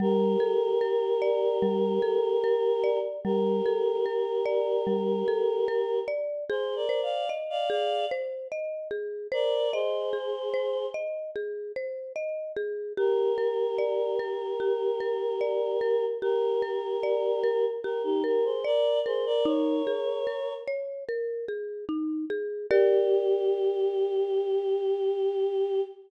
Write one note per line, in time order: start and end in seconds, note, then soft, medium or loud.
0.00 0.36 G3 loud
0.00 2.98 G4 medium
0.00 2.98 A#4 medium
0.40 0.77 A4 medium
0.81 1.18 A#4 medium
1.22 1.58 D5 medium
1.62 1.99 G3 medium
2.02 2.39 A4 medium
2.44 2.80 A#4 medium
2.84 3.20 D5 medium
3.24 3.61 G3 medium
3.24 5.99 G4 medium
3.24 5.99 A#4 medium
3.66 4.02 A4 medium
4.06 4.42 A#4 medium
4.46 4.82 D5 medium
4.87 5.23 G3 medium
5.28 5.64 A4 medium
5.68 6.05 A#4 medium
6.08 6.44 D5 medium
6.49 6.75 G#4 medium
6.49 6.86 G#4 loud
6.49 6.75 C5 medium
6.76 7.01 A#4 medium
6.76 7.01 D5 medium
6.89 7.26 C5 medium
7.03 7.29 D5 medium
7.03 7.29 F5 medium
7.29 7.66 D#5 medium
7.50 7.69 D5 medium
7.50 7.69 F5 medium
7.70 8.06 G#4 medium
7.70 8.05 D5 medium
7.70 8.05 F5 medium
8.11 8.48 C5 medium
8.52 8.88 D#5 medium
8.91 9.27 G#4 medium
9.32 9.71 A#4 medium
9.32 9.68 C5 medium
9.32 9.71 D5 medium
9.73 10.86 G#4 medium
9.73 10.86 C5 medium
9.73 10.10 D#5 medium
10.13 10.49 G#4 medium
10.54 10.90 C5 medium
10.94 11.31 D#5 medium
11.36 11.72 G#4 medium
11.76 12.13 C5 medium
12.16 12.52 D#5 medium
12.56 12.93 G#4 medium
12.97 13.34 G4 medium
12.97 16.05 G4 medium
12.97 16.05 A#4 medium
13.38 13.74 A#4 medium
13.78 14.15 D5 medium
14.19 14.56 A#4 medium
14.60 14.96 G4 medium
15.00 15.37 A#4 medium
15.41 15.77 D5 medium
15.81 16.18 A#4 medium
16.22 17.65 G4 medium
16.22 16.59 G4 medium
16.22 17.65 A#4 medium
16.62 16.99 A#4 medium
17.03 17.40 D5 medium
17.44 17.80 A#4 medium
17.83 18.02 G4 medium
17.83 18.21 G4 medium
17.83 18.02 A#4 medium
18.04 18.23 D#4 medium
18.04 18.23 G4 medium
18.24 18.44 G4 medium
18.24 18.60 A#4 medium
18.24 18.44 A#4 medium
18.44 18.64 G#4 medium
18.44 18.64 C5 medium
18.64 18.99 A#4 medium
18.64 19.01 D5 medium
18.64 18.99 D5 medium
19.06 19.25 G#4 medium
19.06 19.42 A#4 medium
19.06 19.25 C5 medium
19.26 19.45 A#4 medium
19.26 19.45 D5 medium
19.45 19.82 D#4 medium
19.45 20.54 A#4 medium
19.45 20.54 C#5 medium
19.87 20.23 G#4 medium
20.27 20.64 A#4 medium
20.68 21.04 C#5 medium
21.09 21.45 A#4 medium
21.48 21.85 G#4 medium
21.89 22.25 D#4 medium
22.30 22.67 G#4 medium
22.70 25.81 G4 loud
22.70 25.81 G4 medium
22.70 25.81 A#4 medium
22.70 25.81 D5 medium